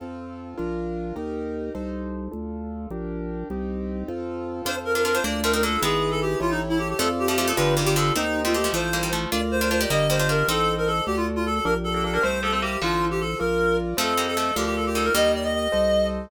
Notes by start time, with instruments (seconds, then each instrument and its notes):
0.00 drawbar organ F2, acoustic grand piano C4 F4 A4
0.58 drawbar organ A#1, acoustic grand piano D4 F4 A#4
1.16 drawbar organ D#2, acoustic grand piano D#4 G4 A#4
1.75 drawbar organ C2, acoustic grand piano D#4 A4 C5
2.31 drawbar organ D2, acoustic grand piano D4 F4 A4
2.90 drawbar organ A#1, acoustic grand piano D4 G4 A#4
3.50 drawbar organ C2, acoustic grand piano C4 D#4 G4
4.08 drawbar organ F2, acoustic grand piano C4 F4 A4
4.65 drawbar organ F2, acoustic grand piano C4 F4 A4, harpsichord D4 F4, clarinet C5
4.85 clarinet A#4
4.95 harpsichord D4 F4, clarinet A#4
5.05 harpsichord D4 F4, clarinet A#4
5.14 harpsichord D4 F4, clarinet C5
5.24 drawbar organ D2, harpsichord A#3 D4, acoustic grand piano D4 F4 A#4, clarinet D5
5.43 harpsichord A3 C4, clarinet A#4
5.53 harpsichord C4 D#4, clarinet A#4
5.63 harpsichord A#3 D4, clarinet A4
5.82 drawbar organ G#1, harpsichord G#3 B3, acoustic grand piano E4 G#4 B4, clarinet G#4
6.11 clarinet A4
6.22 clarinet G4
6.40 drawbar organ A1, acoustic grand piano E4 G4 A4 C#5, clarinet F4
6.50 clarinet D#4
6.69 clarinet E4
6.79 clarinet G4
6.89 clarinet G4
6.99 drawbar organ F2, harpsichord F3 A3, acoustic grand piano F4 A4 D5, clarinet A4
7.19 clarinet G4
7.28 harpsichord F3 A3, clarinet G4
7.38 harpsichord F3 A3, clarinet G4
7.48 harpsichord F3 A3, clarinet A4
7.57 drawbar organ G1, harpsichord D3 F3, acoustic grand piano F4 G4 B4 D5, clarinet B4
7.77 harpsichord C3 D#3, clarinet G4
7.86 harpsichord D#3 G3, clarinet G4
7.96 harpsichord D3 F3, clarinet A4
8.15 drawbar organ D#2, harpsichord A3 C4, clarinet D#4, acoustic grand piano G4 C5 D#5
8.44 harpsichord A3 C4, clarinet F4
8.54 harpsichord A3 C4, clarinet G4
8.64 harpsichord F3 A3
8.73 drawbar organ A1, harpsichord F3 A3, acoustic grand piano F4 A4 C5, clarinet C5
8.93 harpsichord G3 A#3
9.03 harpsichord D#3 G3
9.13 harpsichord F3 A3
9.31 drawbar organ D2, harpsichord D4 F4, acoustic grand piano F4 A#4 D5, clarinet D5
9.51 clarinet C5
9.61 harpsichord D4 F4, clarinet C5
9.71 harpsichord D4 F4, clarinet C5
9.81 harpsichord D#4 G4, clarinet D5
9.90 drawbar organ G1, harpsichord G3 A#3, acoustic grand piano G4 A#4 D#5, clarinet D#5
10.10 harpsichord G3 A#3, clarinet C5
10.19 harpsichord D4 F4, clarinet C5
10.29 harpsichord D4 F4, clarinet A#4
10.48 drawbar organ A1, harpsichord C4 D#4, clarinet A4, acoustic grand piano A4 C5 D#5
10.78 clarinet A#4
10.87 clarinet A4
11.06 drawbar organ D2, acoustic grand piano F#4 A4 D5, clarinet G4
11.16 clarinet F4
11.36 clarinet F4
11.46 clarinet A4
11.55 clarinet A4
11.65 drawbar organ A#1, harpsichord A#3 D4, acoustic grand piano G4 A#4 D5, clarinet A#4
11.84 clarinet A4
11.94 harpsichord A#3 D4, clarinet A4
12.04 harpsichord A#3 D4, clarinet A4
12.14 harpsichord A#3 D4, clarinet A#4
12.22 drawbar organ C2, harpsichord A3 C4, acoustic grand piano G4 C5 E5, clarinet C5
12.43 harpsichord F3 A3, clarinet A4
12.52 harpsichord A3 C4, clarinet A4
12.62 harpsichord G3 A#3, clarinet G4
12.81 drawbar organ A1, harpsichord D3 F3, clarinet F4, acoustic grand piano F4 A4 C5
13.11 clarinet G4
13.20 clarinet A4
13.39 drawbar organ A#1, acoustic grand piano F4 A#4 D5, clarinet A#4
13.97 drawbar organ F2, harpsichord F3 A3, acoustic grand piano F4 A4 C5 D#5, clarinet A4
14.17 harpsichord G3 A#3
14.27 clarinet A4
14.37 harpsichord F3 A3, clarinet A4
14.56 drawbar organ D2, harpsichord D3 F3, acoustic grand piano F4 A#4 D5, clarinet G4
14.66 clarinet G4
14.76 clarinet A4
14.86 clarinet G4
14.95 harpsichord D#3 G3, clarinet A4
15.04 clarinet A#4
15.14 drawbar organ D#2, harpsichord D#3 G3, acoustic grand piano G4 A#4 D#5, clarinet D#5
15.35 clarinet D5
15.44 clarinet D#5
15.54 clarinet D#5
15.72 drawbar organ C2, acoustic grand piano A4 C5 D#5